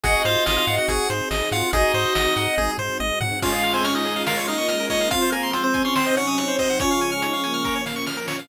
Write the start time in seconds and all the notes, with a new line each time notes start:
0.04 G#1 C4 D#4 F#4 G#4 D#5 F#5, kick, closed hi-hat
0.15 D#5
0.25 G#2 F4 C5 F5, closed hi-hat
0.46 G#1 F4 D#5 F5, snare
0.57 F4 F5
0.67 G#2 D#5 F#5, closed hi-hat
0.78 F#4 F#5
0.88 G#1 F#4 G#4 F#5, kick, closed hi-hat
1.09 G#2 C5, snare, closed hi-hat
1.31 G#1 D#5, snare
1.52 G#2 F4 F5 F#5, closed hi-hat
1.73 G#1 C4 D#4 F#4 G#4 D#5, kick, closed hi-hat
1.94 G#2 C5, closed hi-hat
2.15 G#1 D#5, snare
2.36 G#2 F#5, closed hi-hat
2.58 G#1 G#4, kick, high tom
2.78 G#2 C5, floor tom
3.00 G#1 D#5, high tom
3.21 G#2 F#5, floor tom
3.41 G#3 C#4 F4 G#4 F5, kick, crash
3.52 G#4
3.63 F5, closed hi-hat
3.74 C4 C5 G#5
3.84 C#4 C#5 F6, closed hi-hat
3.95 C#4 D#4 D#5
4.05 G#4, closed hi-hat
4.16 F5
4.26 A#3 C#4 F4 A#4 F5, snare
4.37 C#5
4.47 D#4 D#5 F5, snare, closed hi-hat
4.58 C#6
4.68 G#3 F6, closed hi-hat
4.80 A#4
4.90 D#4 C#5 D#5, kick, open hi-hat
5.01 F5
5.10 F3 G#3 C4 F4 F5, kick, closed hi-hat
5.22 C5
5.32 A#3 A#4 G#5, closed hi-hat
5.43 C6
5.53 C4 F4 C5, closed hi-hat
5.64 C4 C5
5.74 G#5, kick, closed hi-hat
5.85 C#4 C#5 C6
5.96 C3 F#3 C4 D#4 C5, snare
6.06 D#5
6.17 C#4 C#5 F#5, snare, closed hi-hat
6.27 D#6
6.38 C4 F#6, closed hi-hat
6.48 C5
6.59 C4 C5 D#5, kick, open hi-hat
6.70 F#5
6.79 C#3 F3 G#3 C#4 F4 C#5, kick, closed hi-hat
6.90 F4 F5
7.01 G#5, closed hi-hat
7.12 F6
7.22 D#4 C#5, closed hi-hat
7.33 C#4 F5
7.44 A#3 G#5, closed hi-hat
7.54 F6
7.64 A#2 F3 C#4 A#4, kick, snare
7.76 C#5
7.86 F5, snare
7.96 C#6
8.07 F6, snare
8.17 A#4
8.28 C#5, snare
8.39 F5